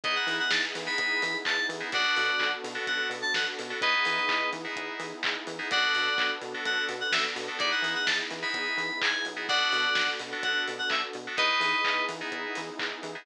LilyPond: <<
  \new Staff \with { instrumentName = "Electric Piano 2" } { \time 4/4 \key b \dorian \tempo 4 = 127 dis''16 fis''8 fis''16 a''16 r8 b''4~ b''16 a''8 r8 | <d'' fis''>4. r8 fis''8 r16 a''16 fis''16 r8. | <b' dis''>4. r2 r8 | <d'' fis''>4. r8 fis''8 r16 fis''16 e''16 r8. |
d''16 fis''8 fis''16 a''16 r8 b''4~ b''16 gis''8 r8 | <d'' fis''>4. r8 fis''8 r16 fis''16 e''16 r8. | <b' dis''>4. r2 r8 | }
  \new Staff \with { instrumentName = "Electric Piano 2" } { \time 4/4 \key b \dorian <b dis' e' gis'>4.~ <b dis' e' gis'>16 <b dis' e' gis'>2 <b dis' e' gis'>16 | <b d' fis' a'>4.~ <b d' fis' a'>16 <b d' fis' a'>2 <b d' fis' a'>16 | <b dis' e' gis'>4.~ <b dis' e' gis'>16 <b dis' e' gis'>2 <b dis' e' gis'>16 | <b d' fis' a'>4.~ <b d' fis' a'>16 <b d' fis' a'>2 <b d' fis' a'>16 |
<b dis' e' gis'>4.~ <b dis' e' gis'>16 <b dis' e' gis'>2 <b dis' e' gis'>16 | <b d' fis' a'>4.~ <b d' fis' a'>16 <b d' fis' a'>2 <b d' fis' a'>16 | <b dis' e' gis'>4.~ <b dis' e' gis'>16 <b dis' e' gis'>2 <b dis' e' gis'>16 | }
  \new Staff \with { instrumentName = "Synth Bass 1" } { \clef bass \time 4/4 \key b \dorian e,8 e8 e,8 e8 e,8 e8 e,8 e8 | b,,8 b,8 b,,8 b,8 b,,8 b,8 b,,8 b,8 | e,8 e8 e,8 e8 e,8 e8 e,8 e8 | b,,8 b,8 b,,8 b,8 b,,8 b,8 b,,8 b,8 |
e,8 e8 e,8 e8 e,8 e8 e,8 b,,8~ | b,,8 b,8 b,,8 b,8 b,,8 b,8 b,,8 b,8 | e,8 e8 e,8 e8 e,8 e8 e,8 e8 | }
  \new Staff \with { instrumentName = "Pad 5 (bowed)" } { \time 4/4 \key b \dorian <b dis' e' gis'>1 | <b d' fis' a'>1 | <b dis' e' gis'>1 | <b d' fis' a'>1 |
<b dis' e' gis'>1 | <b d' fis' a'>1 | <b dis' e' gis'>1 | }
  \new DrumStaff \with { instrumentName = "Drums" } \drummode { \time 4/4 <hh bd>8 hho8 <bd sn>8 hho8 <hh bd>8 hho8 <hc bd>8 hho8 | <hh bd>8 hho8 <hc bd>8 hho8 <hh bd>8 hho8 <bd sn>8 hho8 | <hh bd>8 hho8 <hc bd>8 hho8 <hh bd>8 hho8 <hc bd>8 hho8 | <hh bd>8 hho8 <hc bd>8 hho8 <hh bd>8 hho8 <bd sn>8 hho8 |
<hh bd>8 hho8 <bd sn>8 hho8 <hh bd>8 hho8 <hc bd>8 hho8 | <hh bd>8 hho8 <bd sn>8 hho8 <hh bd>8 hho8 <hc bd>8 hho8 | <hh bd>8 hho8 <hc bd>8 hho8 <hh bd>8 hho8 <hc bd>8 hho8 | }
>>